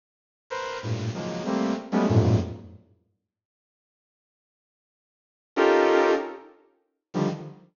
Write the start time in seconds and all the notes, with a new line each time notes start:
0.50 A#4 B4 C5
0.83 G2 A2 A#2
1.14 C#3 D#3 F3 F#3 G#3 A#3
1.45 G3 A3 A#3 C4
1.92 F#3 G3 G#3 A3 B3 C#4
2.09 F2 F#2 G2 G#2 A2 A#2
5.56 C#4 D#4 F4 G4 A4 A#4
7.14 D3 D#3 F3 G3